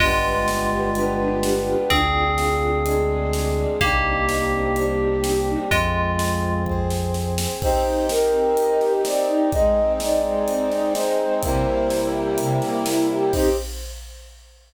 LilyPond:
<<
  \new Staff \with { instrumentName = "Tubular Bells" } { \time 4/4 \key c \minor \tempo 4 = 126 <aes f'>1 | <c' aes'>1 | <bes g'>1 | <aes f'>2 r2 |
r1 | r1 | r1 | r1 | }
  \new Staff \with { instrumentName = "Flute" } { \time 4/4 \key c \minor r1 | r1 | r1 | r1 |
c''4 bes'2 d''4 | ees''4 d''2 c''4 | c''4. r2 r8 | c''4 r2. | }
  \new Staff \with { instrumentName = "String Ensemble 1" } { \time 4/4 \key c \minor <d' f' g' b'>8 <d' f' g' b'>8 <d' f' g' b'>8 <d' f' g' b'>8 <d' f' g' b'>8 <d' f' g' b'>8 <d' f' g' b'>8 <d' f' g' b'>8 | <d' f' aes'>8 <d' f' aes'>8 <d' f' aes'>8 <d' f' aes'>8 <d' f' aes'>8 <d' f' aes'>8 <d' f' aes'>8 <d' f' aes'>8 | <c' d' ees' g'>8 <c' d' ees' g'>8 <c' d' ees' g'>8 <c' d' ees' g'>8 <c' d' ees' g'>8 <c' d' ees' g'>8 <c' d' ees' g'>8 <c' d' ees' g'>8 | r1 |
c'8 ees'8 g'8 c'8 ees'8 g'8 c'8 ees'8 | aes8 c'8 ees'8 aes8 c'8 ees'8 aes8 c'8 | c8 bes8 e'8 g'8 c8 bes8 e'8 g'8 | <c' ees' g'>4 r2. | }
  \new Staff \with { instrumentName = "Synth Bass 2" } { \clef bass \time 4/4 \key c \minor g,,1 | d,1 | c,1 | f,1 |
r1 | r1 | r1 | r1 | }
  \new Staff \with { instrumentName = "Brass Section" } { \time 4/4 \key c \minor <b d' f' g'>2 <b d' g' b'>2 | <d' f' aes'>2 <aes d' aes'>2 | <c' d' ees' g'>2 <g c' d' g'>2 | <c' f' aes'>2 <c' aes' c''>2 |
<c' ees' g'>1 | <aes c' ees'>1 | <c g bes e'>1 | <c' ees' g'>4 r2. | }
  \new DrumStaff \with { instrumentName = "Drums" } \drummode { \time 4/4 <cymc bd>4 sn4 hh4 sn4 | <hh bd>4 sn4 hh4 sn4 | <hh bd>4 sn4 hh4 sn4 | <hh bd>4 sn4 bd8 sn8 sn8 sn8 |
<cymc bd>4 sn4 hh8 sn8 sn4 | <hh bd>4 sn4 hh8 sn8 sn4 | <hh bd>4 sn4 hh8 sn8 sn4 | <cymc bd>4 r4 r4 r4 | }
>>